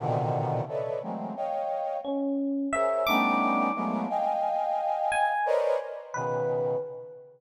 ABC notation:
X:1
M:2/4
L:1/8
Q:1/4=88
K:none
V:1 name="Brass Section"
[^A,,B,,C,D,^D,]2 [=AB^c=d^de] [E,^F,^G,A,^A,=C] | [^c^dfg]2 z2 | [^G^Ac^c] [=G,=A,B,^CD^D]2 [^F,^G,A,^A,B,] | [^dfg^g]4 |
[^ABc^cd^d] z [B,,^C,^D,]2 |]
V:2 name="Electric Piano 1"
z4 | z2 ^C2 | e d'2 z | z3 ^g |
z2 B2 |]